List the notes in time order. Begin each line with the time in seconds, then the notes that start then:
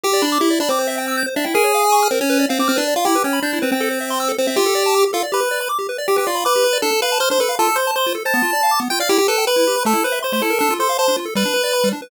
0.03 G4
0.13 D5
0.22 D4 B5
0.32 D6
0.40 E4 G4
0.50 D5
0.60 D4 B5
0.69 C4 D6
0.79 C5
0.87 E5
0.98 G5
1.08 E6
1.17 G6
1.26 C5
1.36 D4 E5
1.44 E4 G5
1.54 G#4 A#4
1.64 C#5
1.74 F5
1.84 G#5
1.92 C#6
2.03 F6
2.11 C4 A#4
2.21 C#4 C#5
2.30 B4
2.39 D5
2.49 C4 F5
2.59 C4 D6
2.68 C4 F6
2.76 D4 B4
2.88 D5
2.96 F4 F5
3.05 E4 G4
3.15 B4
3.24 C#4 G5
3.33 B5
3.42 D4 G6
3.53 E4
3.62 C4 B4
3.72 C4 G5
3.80 A4
3.91 C5
4.01 E5
4.10 C6
4.20 E6
4.28 A4
4.38 C4 C5
4.47 C4 E5
4.56 F4 G4
4.66 A4
4.75 D5
4.86 A5
4.94 D6
5.03 G4
5.13 F4 A4
5.23 D5
5.32 G4 B4
5.40 B4
5.51 D5
5.61 B5
5.69 D6
5.79 G4
5.89 B4
5.98 D5
6.08 G4
6.16 G4 B4
6.27 F4 D5
6.35 B5
6.45 B4 D6
6.56 G4
6.64 B4
6.73 D5
6.82 D4 A4
6.92 A4
7.02 B4 F5
7.12 A5
7.20 C5 F6
7.30 D4 C5
7.40 A4 B4
7.49 F5
7.59 F4 A4
7.69 A4
7.76 C5
7.87 A5
7.96 C5 C6
8.06 F4
8.15 A4
8.25 C5 A5
8.34 B3
8.42 F4
8.53 D5
8.63 F5
8.71 D6
8.80 B3
8.90 F4 G5
9.00 D5 F5
9.09 E4 G4
9.18 G4
9.28 A4 B4
9.38 G5
9.47 B4 B5
9.56 E4
9.67 G4
9.76 B4
9.85 A3 A4
9.93 E4
10.04 B4 C5
10.12 E5
10.22 C5 C6
10.32 A3 C5
10.42 E4 A4
10.50 A#4
10.59 D4 A4
10.70 F4
10.79 A4 C5
10.89 F5
10.98 C5 A5
11.08 D4
11.17 F4
11.25 A4
11.35 G3 B4
11.45 D4
11.54 B4
11.64 D5
11.73 B5
11.84 G3
11.93 D4
12.02 B4